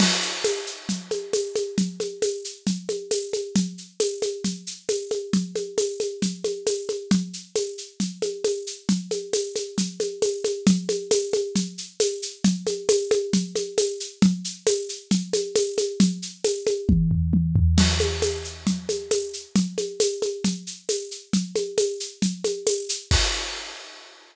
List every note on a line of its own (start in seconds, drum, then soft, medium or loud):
0.00 crash loud
0.00 low conga loud
0.00 shaker medium
0.22 shaker medium
0.44 tambourine medium
0.44 high conga medium
0.44 shaker medium
0.67 shaker medium
0.89 low conga medium
0.89 shaker medium
1.11 high conga medium
1.11 shaker medium
1.33 tambourine medium
1.33 high conga medium
1.33 shaker medium
1.56 high conga medium
1.56 shaker medium
1.78 low conga medium
1.78 shaker medium
2.00 high conga medium
2.00 shaker medium
2.22 tambourine medium
2.22 high conga medium
2.22 shaker medium
2.44 shaker medium
2.67 low conga medium
2.67 shaker medium
2.89 high conga medium
2.89 shaker medium
3.11 tambourine medium
3.11 high conga medium
3.11 shaker medium
3.33 high conga medium
3.33 shaker medium
3.56 low conga loud
3.56 shaker medium
3.78 shaker medium
4.00 tambourine medium
4.00 high conga medium
4.00 shaker medium
4.22 high conga medium
4.22 shaker medium
4.44 low conga medium
4.44 shaker medium
4.67 shaker medium
4.89 tambourine medium
4.89 high conga medium
4.89 shaker medium
5.11 high conga medium
5.11 shaker medium
5.33 low conga loud
5.33 shaker medium
5.56 high conga medium
5.56 shaker medium
5.78 tambourine medium
5.78 high conga medium
5.78 shaker medium
6.00 high conga medium
6.00 shaker medium
6.22 low conga medium
6.22 shaker medium
6.44 high conga medium
6.44 shaker medium
6.67 tambourine medium
6.67 high conga medium
6.67 shaker medium
6.89 high conga medium
6.89 shaker medium
7.11 low conga loud
7.11 shaker medium
7.33 shaker medium
7.56 tambourine medium
7.56 high conga medium
7.56 shaker medium
7.78 shaker medium
8.00 low conga medium
8.00 shaker medium
8.22 high conga medium
8.22 shaker medium
8.44 tambourine medium
8.44 high conga medium
8.44 shaker medium
8.67 shaker medium
8.89 low conga loud
8.89 shaker medium
9.11 high conga medium
9.11 shaker medium
9.33 tambourine medium
9.33 high conga medium
9.33 shaker medium
9.56 high conga medium
9.56 shaker medium
9.78 low conga medium
9.78 shaker medium
10.00 high conga medium
10.00 shaker medium
10.22 tambourine medium
10.22 high conga medium
10.22 shaker medium
10.44 high conga medium
10.44 shaker medium
10.67 low conga loud
10.67 shaker medium
10.89 high conga medium
10.89 shaker medium
11.11 tambourine medium
11.11 high conga medium
11.11 shaker medium
11.33 high conga medium
11.33 shaker medium
11.56 low conga medium
11.56 shaker medium
11.78 shaker medium
12.00 tambourine medium
12.00 high conga medium
12.00 shaker loud
12.22 shaker medium
12.44 low conga loud
12.44 shaker medium
12.67 high conga medium
12.67 shaker medium
12.89 tambourine medium
12.89 high conga loud
12.89 shaker medium
13.11 high conga loud
13.11 shaker medium
13.33 low conga loud
13.33 shaker medium
13.56 high conga medium
13.56 shaker medium
13.78 tambourine medium
13.78 high conga medium
13.78 shaker medium
14.00 shaker medium
14.22 low conga loud
14.22 shaker medium
14.44 shaker medium
14.67 tambourine medium
14.67 high conga medium
14.67 shaker medium
14.89 shaker medium
15.11 low conga loud
15.11 shaker medium
15.33 high conga medium
15.33 shaker medium
15.56 tambourine medium
15.56 high conga medium
15.56 shaker medium
15.78 high conga medium
15.78 shaker medium
16.00 low conga loud
16.00 shaker medium
16.22 shaker medium
16.44 tambourine medium
16.44 high conga medium
16.44 shaker medium
16.67 high conga medium
16.67 shaker medium
16.89 kick loud
16.89 high tom medium
17.11 floor tom loud
17.33 high tom medium
17.56 floor tom loud
17.78 crash loud
17.78 low conga loud
17.78 shaker medium
18.00 high conga medium
18.00 shaker medium
18.22 tambourine medium
18.22 high conga medium
18.22 shaker medium
18.44 shaker medium
18.67 low conga medium
18.67 shaker medium
18.89 high conga medium
18.89 shaker medium
19.11 tambourine medium
19.11 high conga medium
19.11 shaker medium
19.33 shaker medium
19.56 low conga loud
19.56 shaker medium
19.78 high conga medium
19.78 shaker medium
20.00 tambourine medium
20.00 high conga medium
20.00 shaker loud
20.22 high conga medium
20.22 shaker medium
20.44 low conga medium
20.44 shaker medium
20.67 shaker medium
20.89 tambourine medium
20.89 high conga medium
20.89 shaker medium
21.11 shaker medium
21.33 low conga medium
21.33 shaker medium
21.56 high conga medium
21.56 shaker medium
21.78 tambourine medium
21.78 high conga medium
21.78 shaker medium
22.00 shaker medium
22.22 low conga medium
22.22 shaker medium
22.44 high conga medium
22.44 shaker medium
22.67 tambourine loud
22.67 high conga medium
22.67 shaker medium
22.89 shaker loud
23.11 kick loud
23.11 crash loud